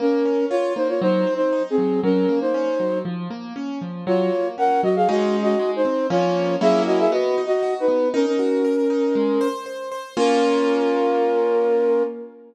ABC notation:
X:1
M:4/4
L:1/16
Q:1/4=118
K:Bbm
V:1 name="Flute"
[DB]4 [Fd]2 [Ec] [Fd] (3[Ec]4 [Ec]4 [CA]4 | [DB]3 [Ec]5 z8 | [Fd]4 [Bg]2 [Ge] [Af] (3[Ge]4 [Ge]4 [Ec]4 | [Fd]4 [A_f]2 [Ge] [Af] (3[Ge]4 [Ge]4 [E_c]4 |
[DB] [DB]11 z4 | B16 |]
V:2 name="Acoustic Grand Piano"
B,2 D2 F2 B,2 G,2 C2 E2 G,2 | G,2 B,2 D2 G,2 F,2 B,2 D2 F,2 | G,2 B,2 D2 G,2 [A,DE]4 A,2 C2 | [F,B,D]4 [G,B,D_F]4 _C2 E2 G2 C2 |
E2 G2 B2 E2 A,2 c2 c2 c2 | [B,DF]16 |]